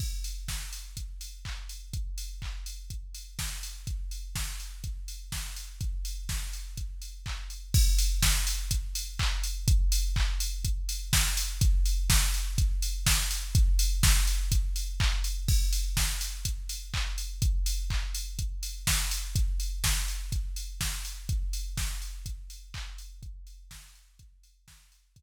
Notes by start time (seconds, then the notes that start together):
0.00 kick, crash
0.24 open hi-hat
0.48 kick, snare
0.73 open hi-hat
0.97 kick, closed hi-hat
1.21 open hi-hat
1.45 kick, clap
1.69 open hi-hat
1.93 kick, closed hi-hat
2.18 open hi-hat
2.42 kick, clap
2.66 open hi-hat
2.90 kick, closed hi-hat
3.15 open hi-hat
3.39 kick, snare
3.63 open hi-hat
3.87 kick, closed hi-hat
4.11 open hi-hat
4.35 kick, snare
4.60 open hi-hat
4.84 kick, closed hi-hat
5.08 open hi-hat
5.32 kick, snare
5.56 open hi-hat
5.81 kick, closed hi-hat
6.05 open hi-hat
6.29 kick, snare
6.53 open hi-hat
6.77 kick, closed hi-hat
7.02 open hi-hat
7.26 kick, clap
7.50 open hi-hat
7.74 kick, crash
7.98 open hi-hat
8.22 kick, snare
8.47 open hi-hat
8.71 kick, closed hi-hat
8.95 open hi-hat
9.19 kick, clap
9.44 open hi-hat
9.68 kick, closed hi-hat
9.92 open hi-hat
10.16 kick, clap
10.40 open hi-hat
10.65 kick, closed hi-hat
10.89 open hi-hat
11.13 kick, snare
11.37 open hi-hat
11.61 kick, closed hi-hat
11.85 open hi-hat
12.10 kick, snare
12.34 open hi-hat
12.58 kick, closed hi-hat
12.82 open hi-hat
13.06 kick, snare
13.31 open hi-hat
13.55 kick, closed hi-hat
13.79 open hi-hat
14.03 kick, snare
14.27 open hi-hat
14.52 kick, closed hi-hat
14.76 open hi-hat
15.00 kick, clap
15.24 open hi-hat
15.48 kick, crash
15.73 open hi-hat
15.97 kick, snare
16.21 open hi-hat
16.45 kick, closed hi-hat
16.69 open hi-hat
16.94 kick, clap
17.18 open hi-hat
17.42 kick, closed hi-hat
17.66 open hi-hat
17.90 kick, clap
18.15 open hi-hat
18.39 kick, closed hi-hat
18.63 open hi-hat
18.87 kick, snare
19.11 open hi-hat
19.35 kick, closed hi-hat
19.60 open hi-hat
19.84 kick, snare
20.08 open hi-hat
20.32 kick, closed hi-hat
20.56 open hi-hat
20.81 kick, snare
21.05 open hi-hat
21.29 kick, closed hi-hat
21.53 open hi-hat
21.77 kick, snare
22.02 open hi-hat
22.26 kick, closed hi-hat
22.50 open hi-hat
22.74 kick, clap
22.98 open hi-hat
23.23 kick, closed hi-hat
23.47 open hi-hat
23.71 kick, snare
23.95 open hi-hat
24.19 kick, closed hi-hat
24.43 open hi-hat
24.68 kick, snare
24.92 open hi-hat
25.16 kick, closed hi-hat